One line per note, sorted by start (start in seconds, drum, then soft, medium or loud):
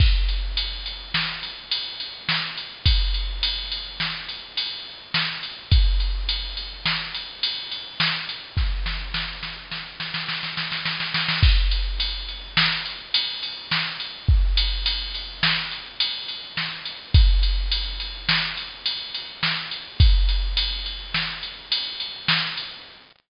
0.00 kick medium
0.00 crash medium
0.28 ride medium
0.57 ride medium
0.86 ride medium
1.14 snare medium
1.43 ride medium
1.71 ride medium
2.00 ride medium
2.29 snare medium
2.57 ride medium
2.86 kick medium
2.86 ride medium
3.14 ride medium
3.43 ride medium
3.72 ride medium
4.00 snare medium
4.29 ride medium
4.57 ride medium
5.14 snare medium
5.43 ride medium
5.71 kick medium
5.71 ride medium
6.00 ride medium
6.29 ride medium
6.57 ride medium
6.85 snare medium
7.14 ride medium
7.43 ride medium
7.71 ride medium
8.00 snare medium
8.29 ride medium
8.57 kick medium
8.57 snare soft
8.86 snare medium
9.14 snare medium
9.43 snare medium
9.71 snare medium
10.00 snare medium
10.14 snare medium
10.28 snare medium
10.43 snare medium
10.57 snare medium
10.72 snare medium
10.85 snare medium
11.00 snare medium
11.14 snare medium
11.28 snare medium
11.43 kick medium
11.43 crash medium
11.71 ride medium
12.00 ride medium
12.29 ride soft
12.57 snare loud
12.85 ride medium
13.14 ride loud
13.43 ride medium
13.71 snare medium
14.00 ride medium
14.28 kick medium
14.57 ride medium
14.86 ride medium
15.14 ride medium
15.43 snare loud
15.71 ride soft
16.00 ride medium
16.28 ride medium
16.57 snare medium
16.85 ride medium
17.14 kick loud
17.14 ride medium
17.43 ride medium
17.72 ride medium
18.00 ride medium
18.29 snare loud
18.57 ride medium
18.86 ride medium
19.14 ride medium
19.43 snare medium
19.71 ride medium
20.00 kick medium
20.00 ride medium
20.29 ride medium
20.57 ride medium
20.86 ride medium
21.14 snare medium
21.43 ride medium
21.72 ride medium
22.00 ride medium
22.28 snare loud
22.57 ride medium